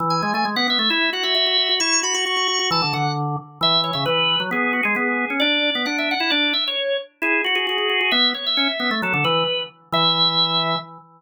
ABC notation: X:1
M:2/4
L:1/16
Q:1/4=133
K:Emix
V:1 name="Drawbar Organ"
z g2 g z f e2 | e2 f e e4 | c'2 b c' c'4 | a2 f2 z4 |
e2 c e B4 | G2 F G G4 | d4 f e f f | d2 e c3 z2 |
G2 F G G4 | e2 c e e4 | A2 B4 z2 | e8 |]
V:2 name="Drawbar Organ"
E,2 G, A, G, B, B, A, | E2 F F F F F F | E2 F F F F F F | E, D, D,4 z2 |
E,3 C, E,3 F, | B,3 G, B,3 C | D3 B, D3 E | D2 z6 |
E2 F F F F F F | B,2 z2 C z B, A, | F, D, E,2 z4 | E,8 |]